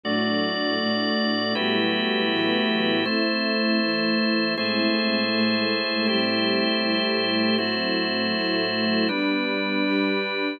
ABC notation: X:1
M:4/4
L:1/8
Q:1/4=159
K:Ador
V:1 name="String Ensemble 1"
[A,,F,D]4 [A,,A,D]4 | [A,,F,G,B,E]4 [A,,E,F,B,E]4 | [A,CE]4 [E,A,E]4 | [A,,^G,CE]4 [A,,G,A,E]4 |
[A,,G,CE]4 [A,,G,A,E]4 | [A,,F,CE]4 [A,,F,A,E]4 | [G,B,D]4 [G,DG]4 |]
V:2 name="Drawbar Organ"
[A,Fd]8 | [A,EFGB]8 | [A,Ec]8 | [A,E^Gc]8 |
[A,EGc]8 | [A,EFc]8 | [G,DB]8 |]